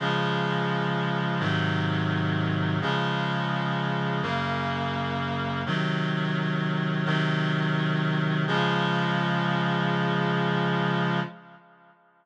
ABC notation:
X:1
M:4/4
L:1/8
Q:1/4=85
K:Db
V:1 name="Clarinet"
[D,F,A,]4 [A,,C,E,G,]4 | [D,F,A,]4 [G,,D,B,]4 | [C,E,G,]4 [C,E,G,]4 | [D,F,A,]8 |]